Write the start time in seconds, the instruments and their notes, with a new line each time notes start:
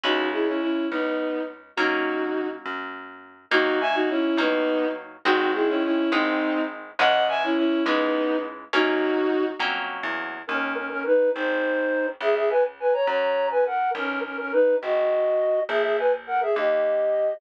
0.04 electric bass (finger) C#2, orchestral harp G#3 C#4 E4, violin D#4 F#4
0.32 violin E4 G#4
0.47 violin C#4 E4
0.61 violin C#4 E4
0.91 electric bass (finger) C#2, violin B3 D#4
1.76 electric bass (finger) F#2, orchestral harp F#3 A#3 C#4, violin D#4 F#4
2.66 electric bass (finger) F#2
3.51 electric bass (finger) D#2, orchestral harp F#3 A#3 D#4, violin D#4 F#4
3.81 violin E5 G#5
3.94 violin D#4 F#4
4.09 violin C#4 E4
4.37 electric bass (finger) D#2, orchestral harp F#3 A#3 D#4, violin B3 D#4
5.25 electric bass (finger) G#1, orchestral harp G#3 C4 D#4, violin D#4 F#4
5.54 violin E4 G#4
5.68 violin C#4 E4
5.84 violin C#4 E4
6.12 electric bass (finger) G#1, orchestral harp G#3 C4 D#4, violin C4 D#4
6.99 electric bass (finger) C#2, orchestral harp E3 G#3 C#4, violin D#5 F#5
7.29 violin E5 G#5
7.43 violin C#4 E4
7.57 violin C#4 E4
7.86 electric bass (finger) C#2, orchestral harp E3 G#3 C#4, violin B3 D#4
8.73 electric bass (finger) F#2, orchestral harp F#3 A#3 C#4, violin D#4 F#4
9.59 electric bass (finger) F2, orchestral harp F#3 A#3 C#4
10.03 electric bass (finger) E2
10.47 electric bass (finger) D#2, flute C#4 A#4
10.76 flute C#4 A#4
10.90 flute C#4 A#4
11.05 flute D#4 B4
11.33 electric bass (finger) G#1, flute D#4 C5
12.20 electric bass (finger) C#2, flute G#4 E5
12.36 flute G#4 E5
12.50 flute B4 G#5
12.80 flute B4 G#5
12.93 flute C#5 A#5
13.07 electric bass (finger) F#2, flute C#5 A#5
13.50 flute B4 G#5
13.66 flute A#4 F#5
13.95 electric bass (finger) B1, flute C#4 A#4
14.24 flute C#4 A#4
14.38 flute C#4 A#4
14.52 flute D#4 B4
14.81 electric bass (finger) G#1, flute F#4 D#5
15.69 electric bass (finger) A#1, flute G#4 E5
15.83 flute G#4 E5
15.98 flute B4 G#5
16.27 flute A#4 F#5
16.41 flute G#4 E5
16.56 electric bass (finger) D#2, flute G4 D#5